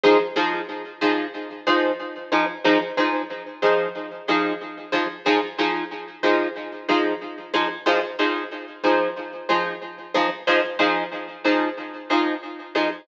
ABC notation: X:1
M:4/4
L:1/8
Q:"Swing 16ths" 1/4=92
K:Fdor
V:1 name="Acoustic Guitar (steel)"
[F,EAc] [F,EAc]2 [F,EAc]2 [F,EAc]2 [F,EAc] | [F,EAc] [F,EAc]2 [F,EAc]2 [F,EAc]2 [F,EAc] | [F,EAc] [F,EAc]2 [F,EAc]2 [F,EAc]2 [F,EAc] | [F,EAc] [F,EAc]2 [F,EAc]2 [F,EAc]2 [F,EAc] |
[F,EAc] [F,EAc]2 [F,EAc]2 [F,EAc]2 [F,EAc] |]